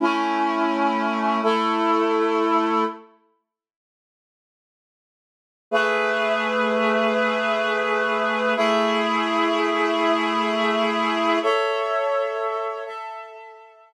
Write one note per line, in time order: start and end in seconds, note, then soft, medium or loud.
0.00 1.41 A3 medium
0.00 1.41 C#4 medium
0.00 1.41 E4 medium
1.43 2.84 A3 medium
1.43 2.84 E4 medium
1.43 2.84 A4 medium
5.71 8.54 A3 medium
5.71 8.54 G#4 medium
5.71 8.54 B4 medium
5.71 8.54 E5 medium
8.56 11.39 A3 medium
8.56 11.39 E4 medium
8.56 11.39 G#4 medium
8.56 11.39 E5 medium
11.42 12.84 A4 medium
11.42 12.84 C#5 medium
11.42 12.84 E5 medium
12.85 13.93 A4 medium
12.85 13.93 E5 medium
12.85 13.93 A5 medium